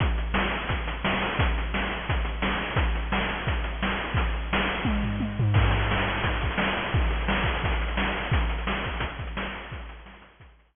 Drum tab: CC |----------------|----------------|----------------|----------------|
HH |x-x---x-x-x---o-|x-x---x-x-x---o-|x-x---x-x-x---x-|x-x---x---------|
SD |----o-------o---|----o-------o---|----o-------o---|----o-----------|
T1 |----------------|----------------|----------------|--------o---o---|
FT |----------------|----------------|----------------|----------o---o-|
BD |o-------o-------|o-------o-------|o-------o-------|o-------o-------|

CC |x---------------|----------------|----------------|----------------|
HH |-xxx-xxxxxxx-xxx|xxxx-xxxxxxx-xxx|xxxx-xxxxxxx-xxx|xxxx-xxxxxxx----|
SD |----o-------o---|----o-------o---|----o-------o---|----o-------o---|
T1 |----------------|----------------|----------------|----------------|
FT |----------------|----------------|----------------|----------------|
BD |o-------o-o-----|o-----o-o-------|o-----o-o-o-----|o-------o-------|